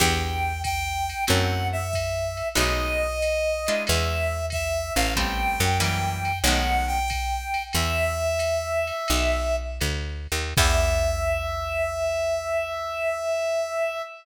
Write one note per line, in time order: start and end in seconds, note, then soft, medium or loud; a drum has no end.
0.00 1.14 E2 loud
0.00 0.52 B3 loud
0.00 0.52 D4 loud
0.00 0.52 E4 medium
0.00 0.52 G4 loud
0.00 0.62 G5 medium
0.00 kick medium
0.00 crash medium
0.00 ride medium
0.64 1.24 G5 loud
0.64 kick medium
0.64 hi-hat pedal medium
0.64 ride medium
1.09 ride medium
1.27 2.42 F#2 medium
1.27 1.80 A3 loud
1.27 1.80 C4 medium
1.27 1.80 E4 loud
1.27 1.80 F#4 loud
1.27 1.67 F#5 medium
1.27 ride loud
1.72 2.48 E5 medium
1.93 kick medium
1.93 hi-hat pedal medium
1.93 ride medium
2.37 ride medium
2.55 3.69 B1 medium
2.55 3.08 G#3 loud
2.55 3.08 A3 medium
2.55 3.08 B3 loud
2.55 3.08 D#4 loud
2.55 3.83 D#5 medium
2.55 ride loud
3.22 hi-hat pedal medium
3.22 ride medium
3.67 4.41 G#3 medium
3.67 4.41 D4 medium
3.67 4.41 E4 loud
3.67 4.41 F4 loud
3.67 ride medium
3.87 4.91 E2 medium
3.87 4.46 E5 medium
3.87 ride loud
4.50 4.93 E5 medium
4.50 kick medium
4.50 hi-hat pedal medium
4.50 ride medium
4.95 5.56 A1 medium
4.95 5.14 F5 medium
4.95 ride medium
5.16 5.69 G3 medium
5.16 5.69 A3 medium
5.16 5.69 B3 loud
5.16 5.69 C4 loud
5.16 5.78 G5 loud
5.16 kick medium
5.16 ride medium
5.60 6.42 F#2 medium
5.80 6.32 E3 loud
5.80 6.32 F#3 medium
5.80 6.32 G3 loud
5.80 6.32 A#3 loud
5.80 6.39 G5 medium
5.80 hi-hat pedal medium
5.80 ride medium
6.25 ride medium
6.44 7.56 B1 medium
6.44 6.99 D#3 loud
6.44 6.99 G#3 medium
6.44 6.99 A3 medium
6.44 6.99 B3 medium
6.44 6.86 F#5 medium
6.44 ride loud
6.87 7.63 G5 medium
7.08 kick medium
7.08 hi-hat pedal medium
7.08 ride medium
7.54 ride medium
7.73 8.92 E2 medium
7.73 9.56 E5 loud
7.73 ride medium
8.39 hi-hat pedal medium
8.39 ride medium
8.87 ride medium
9.08 9.80 B1 medium
9.08 ride loud
9.81 10.27 D2 medium
9.81 hi-hat pedal medium
9.81 ride medium
10.32 10.54 D#2 medium
10.32 ride medium
10.57 14.02 E2 loud
10.57 14.03 B3 loud
10.57 14.03 D4 loud
10.57 14.03 E4 loud
10.57 14.03 G4 loud
10.57 14.02 E5 loud
10.57 kick loud
10.57 crash loud